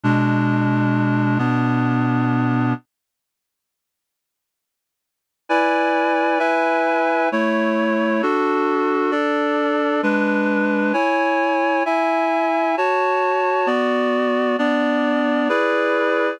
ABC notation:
X:1
M:3/4
L:1/8
Q:1/4=66
K:F#m
V:1 name="Clarinet"
[B,,G,D]3 [B,,B,D]3 | z6 | [K:A] [EBdg]2 [EBeg]2 [A,Ec]2 | [DFA]2 [DAd]2 [G,DB]2 |
[Ecg]2 [Eeg]2 [Fca]2 | [B,Fd]2 [B,Dd]2 [EGBd]2 |]